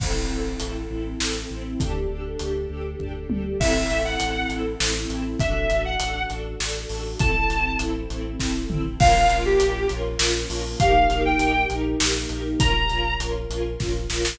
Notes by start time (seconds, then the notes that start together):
0.00 A1 C4 E4 A4, kick, crash
0.30 A1 C4 E4 A4
0.60 A1 C4 E4 A4, closed hi-hat
0.90 A1 C4 E4 A4
1.20 A1 C4 E4 A4, snare
1.50 A1 C4 E4 A4
1.78 D2 D4 G4 A4, kick, closed hi-hat
2.10 D2 D4 G4 A4
2.39 D2 D4 G4 A4, closed hi-hat
2.70 D2 D4 G4 A4
3.00 D2 D4 G4 A4, kick, floor tom
3.30 D2 D4 G4 A4, high tom
3.60 A1 C4 E4 A4 E5, kick, crash
3.90 A1 C4 E4 A4, closed hi-hat
4.05 F#5
4.20 A1 C4 E4 A4, closed hi-hat
4.49 A1 C4 E4 A4, closed hi-hat
4.80 A1 C4 E4 A4, snare
5.10 A1 C4 E4 A4, closed hi-hat
5.40 A1 D4 F#4 A4 E5, kick, closed hi-hat
5.70 A1 D4 F#4 A4, closed hi-hat
5.85 F#5
6.00 A1 D4 F#4 A4, closed hi-hat
6.30 A1 D4 F#4 A4, closed hi-hat
6.60 A1 D4 F#4 A4, snare
6.89 A1 D4 F#4 A4, open hi-hat
7.19 A1 C4 E4 A4 A5, kick, closed hi-hat
7.50 A1 C4 E4 A4, closed hi-hat
7.79 A1 C4 E4 A4, closed hi-hat
8.10 A1 C4 E4 A4, closed hi-hat
8.40 A1 C4 E4 A4, kick, snare
8.70 A1 C4 E4 A4, mid tom
8.98 A#1 A#3 C#4 F4 A#4 F5, kick, crash
9.30 A#1 C#4 F4 A#4, closed hi-hat
9.45 G4
9.60 A#1 C#4 F4 A#4, closed hi-hat
9.89 A#1 C#4 F4 A#4, closed hi-hat
10.19 A#1 C#4 F4 A#4, snare
10.50 A#1 C#4 F4 A#4, open hi-hat
10.80 A#1 A#3 D#4 G4 A#4 F5, kick, closed hi-hat
11.09 A#1 D#4 G4 A#4, closed hi-hat
11.25 G5
11.39 A#1 D#4 G4 A#4, closed hi-hat
11.70 A#1 D#4 G4 A#4, closed hi-hat
12.00 A#1 D#4 G4 A#4, snare
12.29 A#1 D#4 G4 A#4, closed hi-hat
12.60 A#1 C#4 F4 A#4 A#5, kick, closed hi-hat
12.89 A#1 C#4 F4 A#4, closed hi-hat
13.20 A#1 C#4 F4 A#4, closed hi-hat
13.50 A#1 C#4 F4 A#4, closed hi-hat
13.80 A#1 C#4 F4 A#4, kick, snare
14.10 A#1 C#4 F4 A#4, snare
14.25 snare